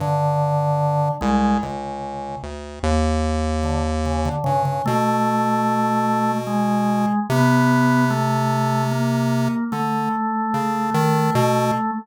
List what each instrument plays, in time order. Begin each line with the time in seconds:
0.00 lead 1 (square) G2, drawbar organ D3
1.21 lead 1 (square) C2, drawbar organ G#3
1.63 lead 1 (square) C#2, drawbar organ C#3
2.43 lead 1 (square) D2
2.83 lead 1 (square) D#2
3.63 drawbar organ D3
4.06 drawbar organ C#3
4.25 drawbar organ D3
4.44 lead 1 (square) G2, drawbar organ C#3
4.65 drawbar organ C#3
4.86 lead 1 (square) B2, drawbar organ A3
6.47 drawbar organ G#3
7.30 lead 1 (square) C3, drawbar organ B3
8.10 drawbar organ A3
8.91 drawbar organ A#3
9.72 lead 1 (square) D3, drawbar organ A3
10.54 lead 1 (square) C#3
10.94 lead 1 (square) D#3
11.35 lead 1 (square) B2